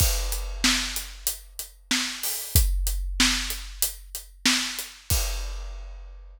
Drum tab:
CC |x-----------------------|------------------------|x-----------------------|
HH |---x-----x--x--x-----o--|x--x-----x--x--x-----x--|------------------------|
SD |------o-----------o-----|------o-----------o-----|------------------------|
BD |o-----------------------|o-----------------------|o-----------------------|